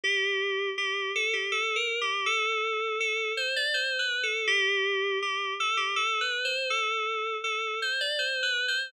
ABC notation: X:1
M:3/4
L:1/16
Q:1/4=81
K:G
V:1 name="Electric Piano 2"
G4 G2 A G (3A2 ^A2 G2 | A4 A2 c d (3c2 B2 A2 | G4 G2 A G (3A2 B2 c2 | A4 A2 c d (3c2 B2 c2 |]